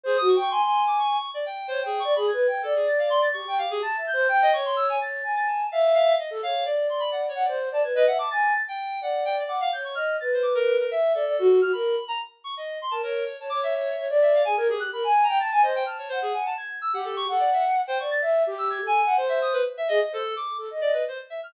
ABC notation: X:1
M:7/8
L:1/16
Q:1/4=127
K:none
V:1 name="Flute"
(3c2 _G2 =g2 _a a5 z4 | _d g2 =d (3_A2 B2 g2 d6 | G g G2 (3a2 e2 c2 g2 _d4 | _d2 _a4 e4 z =A d2 |
d6 _g c2 d B _e =e a | _a2 z4 d4 _g2 _d2 | _e2 B6 =e2 d d _G2 | _G _B2 z8 B _d2 |
z _d d4 d =d3 _A _B G2 | _B _a2 g =a _a c2 =a2 _g4 | z3 G3 _g5 =g d2 | e2 G3 A2 _g c4 z2 |
_A z c z3 =A _e e2 z4 |]
V:2 name="Lead 1 (square)"
_A _e' _d' d' c'3 =d' _d'3 =d g2 | (3c2 _A2 _d'2 b _a'3 =A _A =a' f c' a' | _d'2 f _A =a'2 g'3 _e d' c' =e' _a | a'3 a' a2 f2 f2 _e z f2 |
d2 c' b (3_g2 _d2 =d2 z a _a' B g d' | a'3 g3 _g2 =g d d' f g' _d' | f'2 a' c d' _B2 B e2 A4 | f' b3 _b z2 _d' _e2 c' a _B2 |
_d a =d' e e3 z e f _a _a' _A _g' | (3b2 _a'2 _b2 =a' a' _e g f' _d c _A _a =a | _a'2 e' _g =A _d' A =d e z2 c _d' =a' | z3 e' (3_a'2 _a2 a2 c e _e' B z =e |
_e e A2 d'2 z2 d B c z =e f' |]